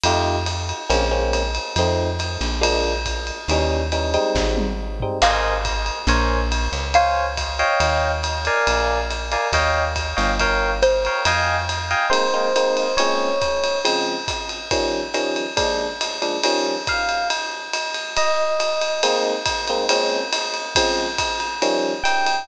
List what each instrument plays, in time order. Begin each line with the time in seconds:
0.04 electric bass (finger) F2, electric piano 1 A3 D#4 F4 G4, ride
0.46 hi-hat pedal, ride
0.69 ride
0.89 electric bass (finger) A#1, electric piano 1 G#3 A#3 C4 C#4, ride
1.11 electric piano 1 G#3 A#3 C4 C#4
1.33 hi-hat pedal, ride
1.55 ride
1.76 electric bass (finger) F2, electric piano 1 F3 A3 C4 D#4, ride
2.19 hi-hat pedal, ride
2.41 electric bass (finger) A#1, ride
2.61 electric piano 1 F3 G#3 A#3 D4, ride
3.05 kick, hi-hat pedal, ride
3.27 ride
3.48 electric bass (finger) D#2, electric piano 1 E3 G3 C#4 D#4, ride
3.92 electric piano 1 E3 G3 C#4 D#4, hi-hat pedal, ride
4.14 electric piano 1 G3 G#3 C4 D#4, ride
4.35 electric bass (finger) G#1, kick, snare
4.57 high tom
5.00 electric piano 1 G3 G#3 C4 D#4, floor tom
5.22 electric bass (finger) G#1, electric piano 1 A#4 C5 D#5 G#5, xylophone F5, crash, ride
5.65 kick, hi-hat pedal, ride
5.86 ride
6.07 electric bass (finger) A#1, electric piano 1 A#4 C5 C#5 G#5, ride
6.51 hi-hat pedal, ride
6.72 electric bass (finger) C#2, ride
6.94 electric piano 1 C5 C#5 F5 G#5, xylophone F5, ride
7.37 kick, hi-hat pedal, ride
7.59 electric piano 1 C#5 D#5 F5 G5, ride
7.80 electric bass (finger) D#2, ride
8.23 hi-hat pedal, ride
8.45 electric piano 1 A#4 D5 F5 G#5, ride
8.67 electric bass (finger) A#1, ride
9.11 hi-hat pedal, ride
9.32 electric piano 1 A#4 D5 F5 G#5, ride
9.52 electric bass (finger) D#2, electric piano 1 C#5 D#5 F5 G5, kick, ride
9.96 kick, hi-hat pedal, ride
10.16 electric bass (finger) G1, electric piano 1 C#5 D#5 F5 G5, ride
10.40 electric piano 1 A#4 C#5 F5 G5, kick, ride
10.82 xylophone C5, hi-hat pedal, ride
11.05 electric piano 1 A#4 C#5 F5 G5, ride
11.25 electric bass (finger) F2, electric piano 1 D#5 F5 G5 G#5, ride
11.69 hi-hat pedal, ride
11.91 electric piano 1 D#5 F5 G5 G#5, ride
12.10 electric piano 1 G#3 A#3 C4 D#4 C5, ride
12.34 electric piano 1 G#3 A#3 C4 D#4
12.56 electric piano 1 G#3 A#3 C4 D#4, hi-hat pedal, ride
12.77 ride
12.97 electric piano 1 A#2 G#3 C4 C#4 C#5, ride
13.41 kick, hi-hat pedal, ride
13.64 ride
13.84 electric piano 1 C#3 F3 G#3 C4, ride
14.28 kick, hi-hat pedal, ride
14.49 ride
14.71 electric piano 1 D#3 F3 G3 C#4, kick, ride
15.14 electric piano 1 D#3 F3 G3 C#4, hi-hat pedal, ride
15.36 ride
15.56 electric piano 1 A#2 F3 G#3 D4, kick, ride
16.01 hi-hat pedal, ride
16.22 electric piano 1 A#2 F3 G#3 D4, ride
16.44 electric piano 1 D#3 F3 G3 C#4, ride
16.87 electric piano 1 F5, kick, hi-hat pedal, ride
17.09 ride
17.30 ride
17.73 hi-hat pedal, ride
17.94 ride
18.17 electric piano 1 D#5, ride
18.60 hi-hat pedal, ride
18.81 ride
19.03 electric piano 1 G#3 A#3 C4 D#4, ride
19.46 kick, hi-hat pedal, ride
19.68 electric piano 1 G#3 A#3 C4 D#4, ride
19.89 electric piano 1 A#2 G#3 C4 C#4, ride
20.33 hi-hat pedal, ride
20.54 ride
20.75 electric piano 1 C#3 F3 G#3 C4, kick, ride
21.18 kick, hi-hat pedal, ride
21.40 ride
21.62 electric piano 1 D#3 F3 G3 C#4, ride
22.04 electric piano 1 G5, hi-hat pedal, ride
22.26 ride